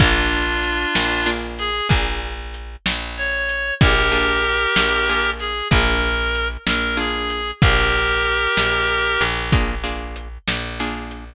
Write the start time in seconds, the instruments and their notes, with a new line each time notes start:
0.00 electric bass (finger) A#1, acoustic guitar (steel) A#3 D4 F4 G#4, clarinet D4 F4, kick, closed hi-hat
0.63 closed hi-hat
0.95 electric bass (finger) A#1, snare
1.26 acoustic guitar (steel) A#3 D4 F4 G#4
1.59 clarinet G#4, closed hi-hat
1.89 electric bass (finger) A#1, acoustic guitar (steel) A#3 D4 F4 G#4, kick, closed hi-hat
2.54 closed hi-hat
2.86 electric bass (finger) A#1, snare
3.17 clarinet C#5
3.49 closed hi-hat
3.81 electric bass (finger) A#1, acoustic guitar (steel) A#3 D4 F4 G#4, clarinet G4 A#4, kick, closed hi-hat
4.12 acoustic guitar (steel) A#3 D4 F4 G#4
4.44 closed hi-hat
4.76 electric bass (finger) A#1, snare
5.09 acoustic guitar (steel) A#3 D4 F4 G#4
5.40 clarinet G#4, closed hi-hat
5.71 electric bass (finger) A#1, acoustic guitar (steel) A#3 D4 F4 G#4, clarinet A#4, kick, closed hi-hat
6.35 closed hi-hat
6.67 electric bass (finger) A#1, clarinet A#4, snare
6.97 acoustic guitar (steel) A#3 D4 F4 G#4, clarinet G#4
7.30 closed hi-hat
7.62 electric bass (finger) A#1, acoustic guitar (steel) A#3 D4 F4 G#4, clarinet G4 A#4, kick, closed hi-hat
8.25 closed hi-hat
8.57 electric bass (finger) A#1, snare
9.21 electric bass (finger) A#1, closed hi-hat
9.52 acoustic guitar (steel) A#3 D4 F4 G#4, kick, closed hi-hat
9.84 acoustic guitar (steel) A#3 D4 F4 G#4
10.16 closed hi-hat
10.48 electric bass (finger) A#1, snare
10.80 acoustic guitar (steel) A#3 D4 F4 G#4
11.11 closed hi-hat